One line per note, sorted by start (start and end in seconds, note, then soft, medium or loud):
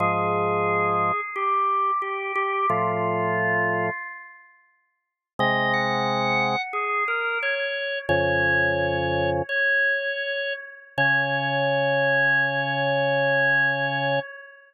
0.00 1.12 G#2 medium
0.00 1.12 F3 medium
0.00 1.21 G#4 medium
1.36 1.91 G4 medium
2.02 2.32 G4 medium
2.35 2.66 G4 medium
2.70 3.90 A2 medium
2.70 3.90 F3 medium
2.70 3.87 F4 medium
5.39 6.56 C3 medium
5.39 6.56 G#3 medium
5.39 5.72 D#5 medium
5.73 6.62 F#5 medium
6.73 7.04 G#4 medium
7.08 7.38 A#4 medium
7.42 7.99 C#5 medium
8.09 9.42 F2 medium
8.09 9.42 C#3 medium
8.09 9.30 C#5 medium
9.49 10.53 C#5 medium
10.97 14.19 C#3 loud
10.97 14.19 C#5 loud